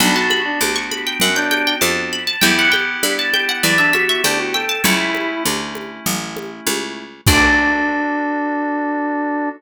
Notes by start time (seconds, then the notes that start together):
0.00 B1 B3 D4 F#4 B5, low conga
0.15 F#4 A5
0.30 B5, high conga
0.45 D4
0.61 D2 D6, high conga
0.76 C#6
0.91 B5, high conga
1.07 G5
1.20 F#2 C#4 F#5, low conga
1.36 D4 G5
1.51 G5, high conga
1.67 G5
1.81 F2 A5, high conga
2.13 B5
2.27 A5
2.41 E2 B3 E4 G4 G5, low conga
2.59 F#5
2.72 G5, high conga
3.03 G2 B5, high conga
3.19 A5
3.33 G5, high conga
3.49 F#5
3.63 E2 E4 D5, low conga
3.78 D4 E5
3.93 F#4 E5, high conga
4.09 E5
4.24 D2 D4 G5, high conga
4.39 F#4
4.54 A4 G5
4.69 A5
4.84 C#2 A3 C#4 E4 C#5, low conga
5.15 high conga
5.45 D2, high conga
5.75 high conga
6.06 A1, low conga
6.37 high conga
6.67 C#2, high conga
7.27 D2 D4 F#4 A4 D5, kick, crash